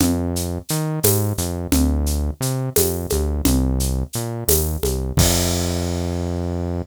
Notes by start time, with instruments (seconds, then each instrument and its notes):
0.00 synth bass 1 F2, low conga, shaker
0.36 shaker
0.69 synth bass 1 D#3, shaker
1.03 synth bass 1 G#2, tambourine, high conga, shaker
1.38 synth bass 1 F2, shaker
1.72 synth bass 1 D2, low conga, shaker
2.06 shaker
2.41 synth bass 1 C3, shaker
2.76 synth bass 1 F2, tambourine, high conga, shaker
3.10 synth bass 1 D2, high conga, shaker
3.45 synth bass 1 C2, low conga, shaker
3.80 shaker
4.13 synth bass 1 A#2, shaker
4.48 synth bass 1 D#2, tambourine, high conga, shaker
4.83 synth bass 1 C2, high conga, shaker
5.17 synth bass 1 F2, kick, crash